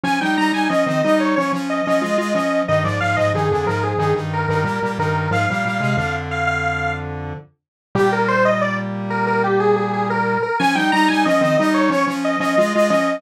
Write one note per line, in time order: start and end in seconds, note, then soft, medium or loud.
0.03 0.19 F3 loud
0.03 0.19 C#4 loud
0.03 0.20 G#5 medium
0.21 0.37 G3 medium
0.21 0.37 D#4 medium
0.21 0.36 G5 medium
0.37 0.52 G3 medium
0.37 0.52 D#4 loud
0.37 0.53 A#5 medium
0.52 0.68 G3 medium
0.52 0.68 D#4 medium
0.52 0.69 G#5 medium
0.69 0.85 F3 medium
0.69 0.85 C#4 loud
0.69 1.01 D#5 medium
0.86 1.02 D#3 medium
0.86 1.02 C4 medium
1.03 1.35 G3 medium
1.03 1.35 D#4 loud
1.03 1.19 D#5 medium
1.20 1.35 C#5 medium
1.36 1.52 F3 medium
1.36 1.52 C#4 medium
1.36 1.52 C#5 medium
1.52 1.81 F3 medium
1.52 1.81 C#4 medium
1.70 1.85 D#5 medium
1.85 2.03 F3 medium
1.85 2.03 C#4 loud
1.85 2.33 D#5 medium
2.01 2.17 G#3 medium
2.01 2.17 F4 medium
2.18 2.33 G#3 medium
2.18 2.33 F4 loud
2.34 2.63 F3 medium
2.34 2.63 C#4 medium
2.34 2.61 D#5 medium
2.68 2.84 G2 medium
2.68 2.84 D#3 medium
2.68 2.84 D#5 medium
2.84 2.99 G#2 medium
2.84 2.99 F3 medium
2.84 3.00 D5 medium
3.00 3.16 G#2 medium
3.00 3.16 F3 medium
3.00 3.16 F5 medium
3.16 3.33 G#2 medium
3.16 3.33 F3 loud
3.16 3.32 D#5 medium
3.34 3.49 G2 medium
3.34 3.49 D#3 medium
3.34 3.67 G#4 medium
3.51 3.66 F2 medium
3.51 3.66 D3 medium
3.66 3.94 G#2 medium
3.66 3.94 F3 medium
3.66 3.82 A#4 medium
3.83 3.99 G#4 medium
3.98 4.14 G2 medium
3.98 4.14 D#3 loud
3.98 4.15 G#4 medium
4.14 4.46 G2 medium
4.14 4.46 D#3 medium
4.33 4.49 A#4 medium
4.48 4.64 G2 medium
4.48 4.64 D#3 medium
4.48 4.92 A#4 medium
4.64 4.80 A#2 medium
4.64 4.80 G3 medium
4.82 4.98 A#2 medium
4.82 4.98 G3 medium
4.98 5.28 G2 medium
4.98 5.28 D#3 medium
4.98 5.30 A#4 medium
5.31 5.46 G#2 medium
5.31 5.46 F3 loud
5.31 6.16 F5 medium
5.50 5.64 A#2 medium
5.50 5.64 G3 medium
5.65 5.81 A#2 medium
5.65 5.81 G3 medium
5.80 5.96 C3 medium
5.80 5.96 G#3 medium
5.97 7.33 F2 medium
5.97 7.33 D3 loud
6.31 6.47 F5 medium
6.47 6.94 F5 medium
7.95 10.38 A#2 loud
7.95 10.38 G3 loud
7.95 8.11 G4 loud
8.12 8.28 A#4 medium
8.28 8.44 C5 loud
8.45 8.61 D#5 medium
8.61 8.77 D5 medium
9.10 9.26 A#4 medium
9.27 9.42 A#4 medium
9.44 9.59 G4 medium
9.60 9.75 G#4 medium
9.76 9.92 G#4 medium
9.93 10.09 G#4 medium
10.10 10.42 A#4 medium
10.42 10.58 A#4 medium
10.59 10.76 F3 loud
10.59 10.76 C#4 loud
10.59 10.75 G#5 loud
10.75 10.91 G3 medium
10.75 10.91 D#4 loud
10.75 10.91 G5 medium
10.92 11.08 G3 loud
10.92 11.08 D#4 loud
10.92 11.07 A#5 loud
11.08 11.25 G3 medium
11.08 11.25 D#4 loud
11.08 11.24 G#5 medium
11.25 11.41 F3 loud
11.25 11.41 C#4 loud
11.25 11.57 D#5 medium
11.41 11.56 D#3 loud
11.41 11.56 C4 loud
11.57 11.90 G3 loud
11.57 11.90 D#4 loud
11.57 11.73 D#5 medium
11.74 11.90 C#5 medium
11.90 12.05 F3 medium
11.90 12.05 C#4 loud
11.90 12.07 C#5 loud
12.07 12.36 F3 loud
12.07 12.36 C#4 loud
12.25 12.40 D#5 medium
12.40 12.56 F3 loud
12.40 12.56 C#4 loud
12.40 12.89 D#5 medium
12.58 12.73 G#3 loud
12.58 12.73 F4 loud
12.75 12.91 G#3 loud
12.75 12.91 F4 loud
12.90 13.18 F3 loud
12.90 13.18 C#4 loud
12.90 13.16 D#5 medium